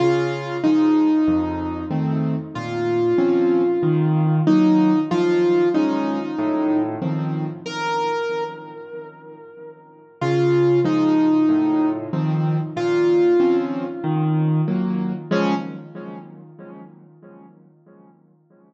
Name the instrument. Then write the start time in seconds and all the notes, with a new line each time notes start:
acoustic grand piano
0.00 C#3 F4
0.64 F3 G#3 D#4
1.27 F2
1.91 D#3 A3 C4
2.55 A#2 F4
3.18 F3 C4 C#4
3.83 D#3
4.47 F#3 A#3 D#4
5.11 F3 F4
5.74 G#3 C#4 D#4
6.39 A2
7.02 D#3 F3 C4
7.66 A#4
10.21 C#3 F4
10.84 F3 G#3 D#4
11.49 A2
12.13 D#3 F3 C4
12.76 A#2 F4
13.40 F3 C4 C#4
14.04 D#3
14.68 F#3 A#3
15.31 C#3 F3 G#3 C#4